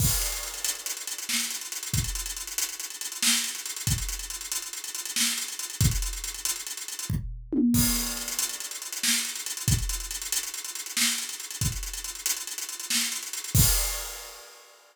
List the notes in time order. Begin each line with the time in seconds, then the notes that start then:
0.00 kick, crash
0.11 closed hi-hat
0.21 closed hi-hat
0.32 closed hi-hat
0.43 closed hi-hat
0.54 closed hi-hat
0.65 closed hi-hat
0.75 closed hi-hat
0.86 closed hi-hat
0.97 closed hi-hat
1.07 closed hi-hat
1.18 closed hi-hat
1.29 snare
1.40 closed hi-hat
1.51 closed hi-hat
1.61 closed hi-hat
1.72 closed hi-hat
1.83 closed hi-hat
1.94 kick, closed hi-hat
2.04 closed hi-hat
2.15 closed hi-hat
2.26 closed hi-hat
2.37 closed hi-hat
2.47 closed hi-hat
2.58 closed hi-hat
2.69 closed hi-hat
2.80 closed hi-hat
2.90 closed hi-hat
3.01 closed hi-hat
3.12 closed hi-hat
3.22 snare
3.33 closed hi-hat
3.44 closed hi-hat
3.55 closed hi-hat
3.66 closed hi-hat
3.76 closed hi-hat
3.87 kick, closed hi-hat
3.98 closed hi-hat
4.09 closed hi-hat
4.19 closed hi-hat
4.30 closed hi-hat
4.41 closed hi-hat
4.52 closed hi-hat
4.62 closed hi-hat
4.73 closed hi-hat
4.84 closed hi-hat
4.95 closed hi-hat
5.05 closed hi-hat
5.16 snare
5.27 closed hi-hat
5.38 closed hi-hat
5.48 closed hi-hat
5.59 closed hi-hat
5.70 closed hi-hat
5.81 kick, closed hi-hat
5.91 closed hi-hat
6.02 closed hi-hat
6.13 closed hi-hat
6.24 closed hi-hat
6.34 closed hi-hat
6.45 closed hi-hat
6.56 closed hi-hat
6.67 closed hi-hat
6.77 closed hi-hat
6.88 closed hi-hat
6.99 closed hi-hat
7.10 kick, floor tom
7.53 high tom
7.74 kick, crash
7.85 closed hi-hat
7.96 closed hi-hat
8.07 closed hi-hat
8.17 closed hi-hat
8.28 closed hi-hat
8.39 closed hi-hat
8.49 closed hi-hat
8.60 closed hi-hat
8.71 closed hi-hat
8.82 closed hi-hat
8.92 closed hi-hat
9.03 snare
9.14 closed hi-hat
9.25 closed hi-hat
9.35 closed hi-hat
9.46 closed hi-hat
9.57 closed hi-hat
9.68 kick, closed hi-hat
9.78 closed hi-hat
9.89 closed hi-hat
10.00 closed hi-hat
10.11 closed hi-hat
10.22 closed hi-hat
10.32 closed hi-hat
10.43 closed hi-hat
10.54 closed hi-hat
10.65 closed hi-hat
10.75 closed hi-hat
10.86 closed hi-hat
10.97 snare
11.08 closed hi-hat
11.18 closed hi-hat
11.29 closed hi-hat
11.40 closed hi-hat
11.51 closed hi-hat
11.61 kick, closed hi-hat
11.72 closed hi-hat
11.83 closed hi-hat
11.94 closed hi-hat
12.04 closed hi-hat
12.15 closed hi-hat
12.26 closed hi-hat
12.37 closed hi-hat
12.47 closed hi-hat
12.58 closed hi-hat
12.69 closed hi-hat
12.80 closed hi-hat
12.90 snare
13.01 closed hi-hat
13.12 closed hi-hat
13.23 closed hi-hat
13.33 closed hi-hat
13.44 closed hi-hat
13.55 kick, crash